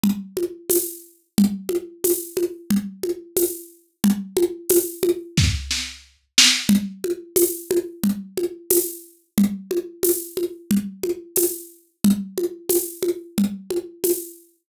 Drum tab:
TB |--x-|--x---x-|--x-----|--x---x-|
SD |----|--------|----oo-o|--------|
CG |Ooo-|OoooOoo-|Oooo----|OoooOoo-|
BD |----|--------|----o---|--------|

TB |--x---x-|--x---x-|
SD |--------|--------|
CG |OoooOoo-|OoooOoo-|
BD |--------|--------|